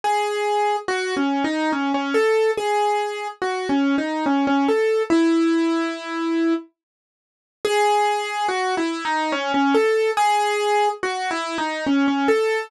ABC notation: X:1
M:3/4
L:1/16
Q:1/4=71
K:C#m
V:1 name="Acoustic Grand Piano"
G4 (3F2 C2 D2 C C A2 | G4 (3F2 C2 D2 C C A2 | E8 z4 | G4 (3F2 E2 D2 C C A2 |
G4 (3F2 E2 D2 C C A2 |]